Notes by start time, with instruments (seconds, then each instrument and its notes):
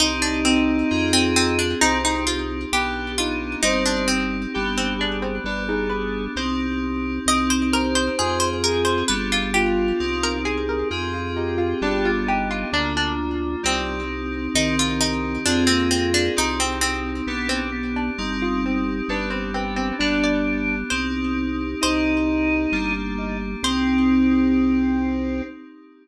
0.00 drawbar organ C2 D#4, electric piano 2 C4 D#4 G4, harpsichord D#4
0.22 harpsichord D4
0.45 harpsichord C4
0.91 drawbar organ F2, electric piano 2 C4 F4 G#4
1.13 harpsichord C4
1.36 harpsichord C4
1.59 harpsichord D4
1.81 drawbar organ C2 C4, electric piano 2 C4 D#4 G4, harpsichord D#4
2.05 harpsichord D#4
2.27 harpsichord F4
2.72 drawbar organ B1 G4, electric piano 2 B3 D4 G4, harpsichord G4
3.18 drawbar organ D#4, harpsichord F4
3.63 drawbar organ G1 C5, electric piano 2 C4 D#4 G4, harpsichord D#4
3.86 harpsichord D4
4.08 harpsichord C4
4.54 drawbar organ G1 G4, electric piano 2 B3 D4 G4
4.78 harpsichord C4
4.99 harpsichord D4, drawbar organ G#4
5.22 harpsichord C4
5.44 drawbar organ G1 B4, electric piano 2 B3 D4 G4, harpsichord D4
5.68 harpsichord D#4, drawbar organ G#4
5.90 harpsichord B4
6.36 drawbar organ C2, electric piano 2 C4 D#4 G4, harpsichord C5
7.26 drawbar organ C2, electric piano 2 C4 D#4 G4, harpsichord D#5
7.50 harpsichord C5
7.72 harpsichord A#4, drawbar organ C5
7.95 harpsichord C5
8.18 drawbar organ F2, electric piano 2 C4 F4 G#4, harpsichord G#4
8.40 harpsichord C5
8.64 drawbar organ G#4, harpsichord A#4
8.85 harpsichord C5
9.08 drawbar organ G1, electric piano 2 B3 D4 G4, harpsichord B4
9.32 harpsichord F4
9.54 drawbar organ F4, harpsichord G4
10.00 drawbar organ C2, electric piano 2 C4 D#4 G4
10.23 harpsichord A#4
10.45 harpsichord G#4, drawbar organ G#4
10.69 harpsichord A#4
10.91 drawbar organ F2, electric piano 2 C4 F4 G#4, harpsichord G#4
11.14 harpsichord F4
11.35 harpsichord D#4, drawbar organ G4
11.58 harpsichord F4
11.81 drawbar organ G1, electric piano 2 B3 D4 G4, harpsichord D4
12.05 harpsichord F4
12.26 drawbar organ D#4, harpsichord G4
12.51 harpsichord F4
12.72 drawbar organ D2 D3, electric piano 2 A#3 D4 F4, harpsichord D4
12.97 harpsichord D4
13.63 drawbar organ C2 G3, electric piano 2 C4 D#4 G4, harpsichord C4
14.54 drawbar organ C2 D#3, electric piano 2 C4 D#4 G4, harpsichord D#4
14.79 harpsichord F4
15.01 harpsichord D#4
15.45 drawbar organ F2 C4, electric piano 2 C4 F4 G#4, harpsichord D4
15.67 drawbar organ A#3, harpsichord C4
15.91 harpsichord C4
16.14 harpsichord D4
16.36 drawbar organ C2, electric piano 2 C4 D#4 G4, harpsichord D#4
16.60 harpsichord C4
16.81 harpsichord C4
17.27 drawbar organ B1 B3, electric piano 2 B3 D4 G4
17.49 harpsichord C4
17.72 drawbar organ B3
17.96 harpsichord D4
18.18 drawbar organ G1, electric piano 2 C4 D#4 G4, harpsichord D#4
18.42 harpsichord F4
18.66 harpsichord C4
19.08 drawbar organ G1 B4, electric piano 2 B3 D4 G4, harpsichord D4
19.30 harpsichord C4
19.54 harpsichord C4, drawbar organ B4
19.76 harpsichord C4
19.99 drawbar organ G1 D4, electric piano 2 B3 D4 G4, harpsichord D4
20.24 harpsichord D5
20.90 drawbar organ C2, electric piano 2 C4 D#4 G4, harpsichord C5
21.81 drawbar organ C2 D#4, electric piano 2 C4 D#4 G4, harpsichord C5
22.72 drawbar organ G1, electric piano 2 A#3 D4 G4
23.18 drawbar organ D#4
23.63 drawbar organ C2 C4, electric piano 2 C4 D#4 G4, harpsichord C5